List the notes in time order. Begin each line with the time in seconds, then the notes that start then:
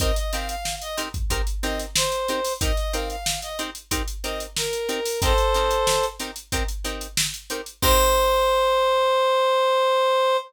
0.00 C4 D#4 G4 A#4 D#5, kick, closed hi-hat
0.16 D#5, closed hi-hat
0.33 C4 D#4 G4 A#4 F5, closed hi-hat
0.49 F5, closed hi-hat
0.65 snare
0.82 D#5, closed hi-hat
0.97 C4 D#4 G4 A#4, snare, closed hi-hat
1.14 kick, closed hi-hat
1.30 C4 D#4 G4 A#4, kick, closed hi-hat
1.47 closed hi-hat
1.63 C4 D#4 G4 A#4 D#5, snare, closed hi-hat
1.79 snare, closed hi-hat
1.96 C5, snare
2.12 snare, closed hi-hat
2.28 C4 D#4 G4 A#4, closed hi-hat
2.44 open hi-hat
2.61 C4 D#4 G4 A#4 D#5, kick, closed hi-hat
2.77 D#5, closed hi-hat
2.93 C4 D#4 G4 A#4 F5, closed hi-hat
3.10 F5, closed hi-hat
3.26 snare
3.42 D#5, snare, closed hi-hat
3.59 C4 D#4 G4 A#4, closed hi-hat
3.75 closed hi-hat
3.91 C4 D#4 G4 A#4, kick, closed hi-hat
4.08 closed hi-hat
4.24 C4 D#4 G4 A#4 D#5, closed hi-hat
4.40 closed hi-hat
4.57 A#4, snare
4.73 snare, closed hi-hat
4.89 C4 D#4 G4 A#4, closed hi-hat
5.05 open hi-hat
5.22 C4 D#4 G4 A4 A#4 C5, kick, closed hi-hat
5.38 closed hi-hat
5.54 C4 D#4 G4 A#4, snare, closed hi-hat
5.71 closed hi-hat
5.87 snare
6.03 closed hi-hat
6.19 C4 D#4 G4 A#4, snare, closed hi-hat
6.36 closed hi-hat
6.52 C4 D#4 G4 A#4, kick, closed hi-hat
6.68 closed hi-hat
6.84 C4 D#4 G4 A#4, closed hi-hat
7.01 closed hi-hat
7.17 snare
7.34 closed hi-hat
7.50 C4 D#4 G4 A#4, closed hi-hat
7.66 closed hi-hat
7.82 C4 D#4 G4 A#4 C5, kick, crash